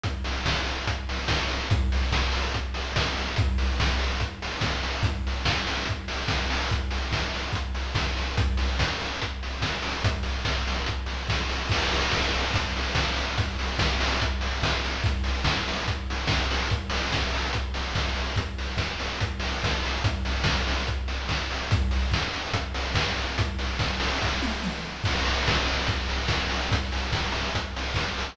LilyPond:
\new DrumStaff \drummode { \time 4/4 \tempo 4 = 144 <hh bd>8 hho8 <bd sn>8 hho8 <hh bd>8 hho8 <bd sn>8 hho8 | <hh bd>8 hho8 <bd sn>8 hho8 <hh bd>8 hho8 <bd sn>8 hho8 | <hh bd>8 hho8 <bd sn>8 hho8 <hh bd>8 hho8 <bd sn>8 hho8 | <hh bd>8 hho8 <bd sn>8 hho8 <hh bd>8 hho8 <bd sn>8 hho8 |
<hh bd>8 hho8 <bd sn>8 hho8 <hh bd>8 hho8 <bd sn>8 hho8 | <hh bd>8 hho8 <bd sn>8 hho8 <hh bd>8 hho8 <bd sn>8 hho8 | <hh bd>8 hho8 <bd sn>8 hho8 <hh bd>8 hho8 <bd sn>8 hho8 | <cymc bd>8 hho8 <bd sn>8 hho8 <hh bd>8 hho8 <bd sn>8 hho8 |
<hh bd>8 hho8 <bd sn>8 hho8 <hh bd>8 hho8 <bd sn>8 hho8 | <hh bd>8 hho8 <bd sn>8 hho8 <hh bd>8 hho8 <bd sn>8 hho8 | <hh bd>8 hho8 <bd sn>8 hho8 <hh bd>8 hho8 <bd sn>8 hho8 | <hh bd>8 hho8 <bd sn>8 hho8 <hh bd>8 hho8 <bd sn>8 hho8 |
<hh bd>8 hho8 <bd sn>8 hho8 <hh bd>8 hho8 <bd sn>8 hho8 | <hh bd>8 hho8 <bd sn>8 hho8 <hh bd>8 hho8 <bd sn>8 hho8 | <hh bd>8 hho8 <bd sn>8 hho8 <bd sn>8 tommh8 toml4 | <cymc bd>8 hho8 <bd sn>8 hho8 <hh bd>8 hho8 <bd sn>8 hho8 |
<hh bd>8 hho8 <bd sn>8 hho8 <hh bd>8 hho8 <bd sn>8 hho8 | }